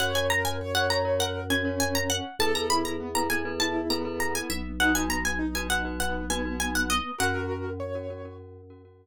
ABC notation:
X:1
M:4/4
L:1/16
Q:1/4=100
K:F#mix
V:1 name="Pizzicato Strings"
f g a g z f a2 f2 g2 g a f2 | =a ^a b a z a g2 =a2 ^a2 a g e2 | f g a g z g f2 f2 g2 g f d2 | f10 z6 |]
V:2 name="Acoustic Grand Piano"
c2 A2 c4 A2 C6 | =A2 E2 B,4 E2 B,6 | D2 B,2 D4 B,2 B,6 | [FA]4 c4 z8 |]
V:3 name="Glockenspiel"
[FAc] [FAc]4 [FAc] [FAc] [FAc]3 [FAc] [FAc]5 | [E=AB] [EAB]4 [EAB] [EAB] [EAB]3 [EAB] [EAB]5 | [DFB] [DFB]4 [DFB] [DFB] [DFB]3 [DFB] [DFB]5 | [CFA] [CFA]4 [CFA] [CFA] [CFA]3 [CFA] [CFA]5 |]
V:4 name="Drawbar Organ" clef=bass
F,,16 | E,,14 B,,,2- | B,,,16 | F,,16 |]